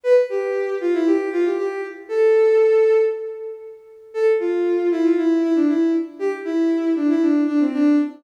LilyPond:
\new Staff { \time 4/4 \key a \minor \tempo 4 = 117 b'16 r16 g'4 f'16 e'16 g'8 f'16 g'16 g'8 r8 | a'2 r2 | a'16 r16 f'4 e'16 f'16 e'8 e'16 d'16 e'8 r8 | g'16 r16 e'4 d'16 e'16 d'8 d'16 c'16 d'8 r8 | }